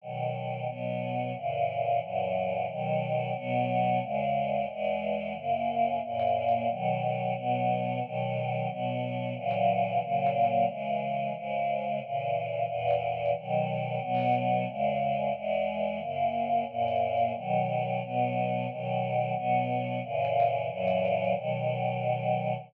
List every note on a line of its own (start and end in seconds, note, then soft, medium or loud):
0.01 0.66 B2 medium
0.01 0.67 D#3 medium
0.01 0.66 F#3 medium
0.66 1.32 B2 medium
0.66 1.32 F#3 medium
0.66 1.32 B3 medium
1.33 1.99 F#2 medium
1.33 1.99 A#2 medium
1.33 1.99 C#3 medium
1.33 1.99 E3 medium
2.00 2.66 F#2 medium
2.00 2.66 A#2 medium
2.00 2.66 E3 medium
2.00 2.66 F#3 medium
2.67 3.33 B2 medium
2.67 3.33 D#3 loud
2.67 3.33 F#3 medium
3.33 3.99 B2 loud
3.33 3.99 F#3 loud
3.33 3.99 B3 loud
4.00 4.66 E2 medium
4.00 4.66 C#3 loud
4.00 4.66 G#3 loud
4.68 5.34 E2 medium
4.68 5.34 E3 medium
4.68 5.34 G#3 loud
5.33 5.99 F#2 medium
5.33 5.99 C#3 medium
5.33 5.99 A#3 medium
6.02 6.68 F#2 loud
6.02 6.68 A#2 medium
6.02 6.68 A#3 loud
6.67 7.33 B2 medium
6.67 7.33 D#3 medium
6.67 7.33 F#3 loud
7.34 8.00 B2 loud
7.34 8.00 F#3 medium
7.34 8.00 B3 medium
8.01 8.67 B2 loud
8.01 8.67 D#3 medium
8.01 8.67 F#3 medium
8.67 9.33 B2 loud
8.67 9.33 F#3 medium
8.67 9.33 B3 medium
9.34 9.99 A#2 loud
9.34 9.99 C#3 medium
9.34 10.00 E3 medium
9.34 9.99 F#3 medium
9.99 10.65 A#2 medium
9.99 10.65 C#3 loud
9.99 10.65 F#3 medium
9.99 10.65 A#3 medium
10.66 11.32 C#3 medium
10.66 11.32 E3 medium
10.66 11.32 G#3 medium
11.34 12.00 G#2 medium
11.34 12.00 C#3 loud
11.34 12.00 G#3 medium
12.01 12.65 A#2 medium
12.01 12.67 C#3 medium
12.01 12.65 E3 medium
12.65 13.31 E2 medium
12.65 13.31 A#2 loud
12.65 13.31 E3 medium
13.35 13.98 B2 medium
13.35 14.01 D#3 loud
13.35 13.98 F#3 medium
13.99 14.65 B2 loud
13.99 14.65 F#3 loud
13.99 14.65 B3 loud
14.66 15.32 E2 medium
14.66 15.32 C#3 loud
14.66 15.32 G#3 loud
15.33 15.99 E2 medium
15.33 15.99 E3 medium
15.33 15.99 G#3 loud
15.98 16.64 F#2 medium
15.98 16.64 C#3 medium
15.98 16.64 A#3 medium
16.66 17.32 F#2 loud
16.66 17.32 A#2 medium
16.66 17.32 A#3 loud
17.34 18.00 B2 medium
17.34 18.00 D#3 medium
17.34 18.00 F#3 loud
18.01 18.67 B2 loud
18.01 18.67 F#3 medium
18.01 18.67 B3 medium
18.68 19.33 B2 medium
18.68 19.34 D#3 medium
18.68 19.33 F#3 medium
19.33 19.99 B2 loud
19.33 19.99 F#3 medium
19.33 19.99 B3 loud
20.02 20.67 F#2 medium
20.02 20.67 A#2 loud
20.02 20.68 C#3 loud
20.02 20.67 E3 loud
20.68 21.34 F#2 loud
20.68 21.34 A#2 loud
20.68 21.34 E3 loud
20.68 21.32 F#3 loud
21.33 22.53 B2 loud
21.33 22.53 D#3 medium
21.33 22.53 F#3 medium